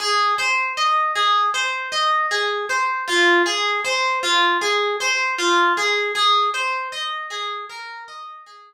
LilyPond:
\new Staff { \time 4/4 \key aes \mixolydian \tempo 4 = 78 aes'8 c''8 ees''8 aes'8 c''8 ees''8 aes'8 c''8 | f'8 aes'8 c''8 f'8 aes'8 c''8 f'8 aes'8 | aes'8 c''8 ees''8 aes'8 bes'8 ees''8 aes'8 r8 | }